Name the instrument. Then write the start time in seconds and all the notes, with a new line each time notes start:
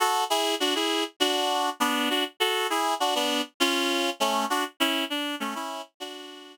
clarinet
0.00 F#4 A4
0.30 E4 G#4
0.60 D4 F#4
0.75 E4 G#4
1.20 D4 F#4
1.80 B3 D4
2.10 D4 F#4
2.40 F#4 A4
2.70 E4 G#4
3.00 D4 F#4
3.15 B3 D4
3.60 C#4 F4
4.20 A3 C#4
4.50 D4 F#4
4.80 C#4 E4
5.10 D4
5.40 A3 C#4
5.55 C#4 E4
6.00 D4 F#4